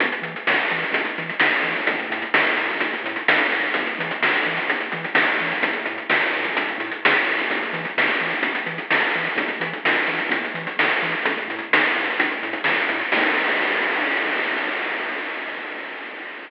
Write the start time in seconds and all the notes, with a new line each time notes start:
0.00 E2, kick, closed hi-hat
0.12 closed hi-hat
0.22 E3, closed hi-hat
0.36 closed hi-hat
0.47 E2, snare
0.58 closed hi-hat
0.71 E3, closed hi-hat
0.83 closed hi-hat
0.92 E2, kick, closed hi-hat
1.05 closed hi-hat
1.18 E3, closed hi-hat
1.29 closed hi-hat
1.40 E2, snare
1.52 kick, closed hi-hat
1.63 E3, closed hi-hat
1.76 kick, closed hi-hat
1.87 A1, kick, closed hi-hat
1.99 closed hi-hat
2.10 A2, closed hi-hat
2.22 closed hi-hat
2.33 A1, snare
2.44 closed hi-hat
2.57 A2, closed hi-hat
2.69 kick, closed hi-hat
2.80 A1, kick, closed hi-hat
2.93 closed hi-hat
3.04 A2, closed hi-hat
3.16 closed hi-hat
3.28 A1, snare
3.39 closed hi-hat
3.52 A2, closed hi-hat
3.63 closed hi-hat
3.74 E2, kick, closed hi-hat
3.86 closed hi-hat
3.99 E3, closed hi-hat
4.11 closed hi-hat
4.21 E2, snare
4.34 closed hi-hat
4.45 E3, closed hi-hat
4.57 closed hi-hat
4.68 E2, kick, closed hi-hat
4.80 closed hi-hat
4.92 E3, closed hi-hat
5.04 closed hi-hat
5.14 E2, snare
5.26 kick, closed hi-hat
5.40 E3, closed hi-hat
5.52 kick, closed hi-hat
5.63 A1, kick, closed hi-hat
5.73 closed hi-hat
5.86 A2, closed hi-hat
5.98 closed hi-hat
6.09 A1, snare
6.22 closed hi-hat
6.33 A2, closed hi-hat
6.44 kick, closed hi-hat
6.56 A1, kick, closed hi-hat
6.69 closed hi-hat
6.78 A2, closed hi-hat
6.92 closed hi-hat
7.04 A1, snare
7.13 closed hi-hat
7.25 A2, closed hi-hat
7.37 kick, closed hi-hat
7.50 E2, kick, closed hi-hat
7.63 closed hi-hat
7.73 E3, closed hi-hat
7.85 closed hi-hat
7.97 E2, snare
8.10 closed hi-hat
8.20 E3, closed hi-hat
8.30 closed hi-hat
8.42 E2, kick, closed hi-hat
8.55 closed hi-hat
8.66 E3, closed hi-hat
8.78 closed hi-hat
8.91 E2, snare
9.00 closed hi-hat
9.14 E3, closed hi-hat
9.24 closed hi-hat
9.36 E2, kick, closed hi-hat
9.48 closed hi-hat
9.60 E3, closed hi-hat
9.73 closed hi-hat
9.84 E2, snare
9.95 closed hi-hat
10.07 E3, closed hi-hat
10.18 kick, closed hi-hat
10.29 E2, kick, closed hi-hat
10.44 closed hi-hat
10.54 E3, closed hi-hat
10.67 closed hi-hat
10.77 E2, snare
10.90 closed hi-hat
11.02 E3, closed hi-hat
11.12 closed hi-hat
11.25 A1, kick, closed hi-hat
11.38 closed hi-hat
11.48 A2, closed hi-hat
11.59 closed hi-hat
11.71 A1, snare
11.83 closed hi-hat
11.95 A2, closed hi-hat
12.09 closed hi-hat
12.18 A1, kick, closed hi-hat
12.31 closed hi-hat
12.43 A2, closed hi-hat
12.53 closed hi-hat
12.64 A1, snare
12.77 closed hi-hat
12.89 A2, closed hi-hat
13.01 closed hi-hat
13.12 E2, kick, crash